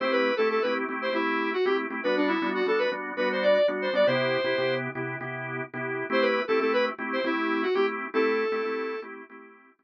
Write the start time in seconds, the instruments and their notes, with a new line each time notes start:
0.00 drawbar organ A3 C4 E4 G4, lead 1 (square) C5
0.12 lead 1 (square) B4
0.37 drawbar organ A3 C4 E4 G4, lead 1 (square) A4
0.50 lead 1 (square) A4
0.62 drawbar organ A3 C4 E4 G4, lead 1 (square) B4
0.89 drawbar organ A3 C4 E4 G4
1.02 lead 1 (square) C5
1.13 drawbar organ A3 C4 E4 G4, lead 1 (square) E4
1.53 lead 1 (square) F#4
1.65 drawbar organ A3 C4 E4 G4, lead 1 (square) G4
1.90 drawbar organ A3 C4 E4 G4
2.03 drawbar organ G3 B3 D4 F#4, lead 1 (square) B4
2.17 lead 1 (square) D4
2.28 lead 1 (square) E4
2.42 drawbar organ G3 B3 D4 F#4
2.55 lead 1 (square) F#4
2.66 drawbar organ G3 B3 D4 F#4, lead 1 (square) A4
2.78 lead 1 (square) B4
2.92 drawbar organ G3 B3 D4 F#4
3.17 drawbar organ G3 B3 D4 F#4, lead 1 (square) B4
3.32 lead 1 (square) C5
3.43 lead 1 (square) D5
3.54 lead 1 (square) D5
3.68 drawbar organ G3 B3 D4 F#4
3.82 lead 1 (square) C5
3.93 drawbar organ G3 B3 D4 F#4, lead 1 (square) D5
4.07 drawbar organ C3 B3 E4 G4, lead 1 (square) C5
4.44 drawbar organ C3 B3 E4 G4
4.58 drawbar organ C3 B3 E4 G4
4.95 drawbar organ C3 B3 E4 G4
5.21 drawbar organ C3 B3 E4 G4
5.74 drawbar organ C3 B3 E4 G4
6.10 drawbar organ A3 C4 E4 G4, lead 1 (square) C5
6.21 lead 1 (square) B4
6.48 drawbar organ A3 C4 E4 G4, lead 1 (square) A4
6.59 drawbar organ A3 C4 E4 G4, lead 1 (square) A4
6.73 lead 1 (square) B4
6.99 drawbar organ A3 C4 E4 G4
7.13 lead 1 (square) C5
7.24 drawbar organ A3 C4 E4 G4, lead 1 (square) E4
7.63 lead 1 (square) F#4
7.74 drawbar organ A3 C4 E4 G4, lead 1 (square) G4
8.14 drawbar organ A3 C4 E4 G4, lead 1 (square) A4
8.52 drawbar organ A3 C4 E4 G4
8.65 drawbar organ A3 C4 E4 G4
9.02 drawbar organ A3 C4 E4 G4
9.30 drawbar organ A3 C4 E4 G4
9.79 drawbar organ A3 C4 E4 G4